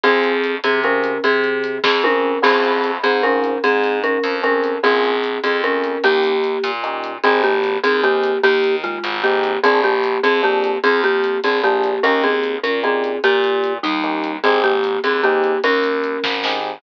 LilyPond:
<<
  \new Staff \with { instrumentName = "Marimba" } { \time 6/8 \key aes \major \tempo 4. = 100 <c' aes'>4. <c' aes'>8 <des' bes'>4 | <c' aes'>4. <c' aes'>8 <des' bes'>4 | <c' aes'>4. <c' aes'>8 <des' bes'>4 | <c' aes'>4 <des' bes'>4 <des' bes'>4 |
<c' aes'>4. <c' aes'>8 <des' bes'>4 | <bes g'>2 r4 | <c' aes'>8 <bes g'>4 <c' aes'>8 <bes g'>4 | <bes g'>4 <aes f'>4 <bes g'>4 |
<c' aes'>8 <bes g'>4 <c' aes'>8 <bes g'>4 | <c' aes'>8 <bes g'>4 <c' aes'>8 <bes g'>4 | <des' bes'>8 <c' aes'>4 <des' bes'>8 <c' aes'>4 | <bes g'>4. <g ees'>4. |
<c' aes'>8 <bes g'>4 <c' aes'>8 <bes g'>4 | <des' bes'>2~ <des' bes'>8 r8 | }
  \new Staff \with { instrumentName = "Electric Piano 1" } { \time 6/8 \key aes \major <c' f' aes'>2 <c' f' aes'>4~ | <c' f' aes'>2 <c' f' aes'>4 | <c' des' f' aes'>2 <c' des' f' aes'>4~ | <c' des' f' aes'>2 <c' des' f' aes'>4 |
<bes des' f' aes'>2 <bes des' f' aes'>4 | <bes des' ees' g'>2 <bes des' ees' g'>4 | <c' ees' g' aes'>2 <c' ees' g' aes'>4~ | <c' ees' g' aes'>2 <c' ees' g' aes'>4 |
<bes d' f' aes'>2 <bes d' f' aes'>4~ | <bes d' f' aes'>2 <bes d' f' aes'>4 | <bes des' ees' g'>2 <bes des' ees' g'>4~ | <bes des' ees' g'>2 <bes des' ees' g'>4 |
<c' ees' g' aes'>2 <c' ees' g' aes'>4~ | <c' ees' g' aes'>2 <c' ees' g' aes'>4 | }
  \new Staff \with { instrumentName = "Electric Bass (finger)" } { \clef bass \time 6/8 \key aes \major f,4. c4. | c4. f,4. | f,4. aes,4. | aes,4. f,4. |
bes,,4. f,4. | ees,4. bes,4. | aes,,4. ees,4. | ees,4. aes,,4. |
bes,,4. f,4. | f,4. bes,,4. | ees,4. bes,4. | bes,4. ees,4. |
aes,,4. ees,4. | ees,4. aes,,4. | }
  \new DrumStaff \with { instrumentName = "Drums" } \drummode { \time 6/8 hh8 hh8 hh8 hh8 hh8 hh8 | hh8 hh8 hh8 <bd sn>8 tommh4 | cymc8 hh8 hh8 hh8 hh8 hh8 | hh8 hh8 hh8 hh8 hh8 hh8 |
hh8 hh8 hh8 hh8 hh8 hh8 | hh8 hh8 hh8 hh8 hh8 hh8 | hh8 hh8 hh8 hh8 hh8 hh8 | hh8 hh8 hh8 hh8 hh8 hh8 |
hh8 hh8 hh8 hh8 hh8 hh8 | hh8 hh8 hh8 hh8 hh8 hh8 | hh8 hh8 hh8 hh8 hh8 hh8 | hh8 hh8 hh8 hh8 hh8 hh8 |
hh8 hh8 hh8 hh8 hh8 hh8 | hh8 hh8 hh8 <bd sn>8 sn4 | }
>>